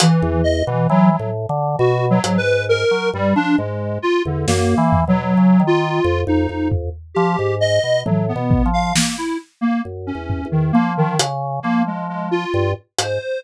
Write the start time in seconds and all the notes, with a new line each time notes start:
0.00 E3, closed hi-hat
0.22 E2
0.44 D#5
0.67 B2 E3
0.89 E3 F#3
1.10 F#3
1.19 A2
1.49 D3
1.79 B2 F#4
2.10 F#3
2.24 G#2, closed hi-hat
2.38 B4
2.69 A#4
2.91 F#3
3.13 G2 G3
3.36 F3 D4
3.58 G#2 G#3
4.02 F4
4.25 E2 D3
4.47 F#2 A#3, snare
4.78 E3
4.93 floor tom
5.07 B2 F#3
5.37 C#3
5.60 D#3
5.67 F4
6.04 F2
6.27 F2 D#4
6.49 F2
6.72 floor tom
7.15 F3 G4
7.39 G#2
7.61 D#5
7.84 B2
8.05 A2 F#3, high tom
8.28 B3
8.36 B2
8.51 kick
8.66 F3
8.73 F5
8.96 A#3, snare
9.17 E4
9.61 A#3
9.85 F#2
10.07 C#4
10.15 E2
10.30 floor tom
10.45 E2
10.51 D#3
10.73 F3 A#3
10.97 D#3
11.19 C#3, closed hi-hat
11.62 F3 A#3
11.87 G#3
12.09 G#3
12.31 F4
12.54 G2
12.99 G#2 C5, closed hi-hat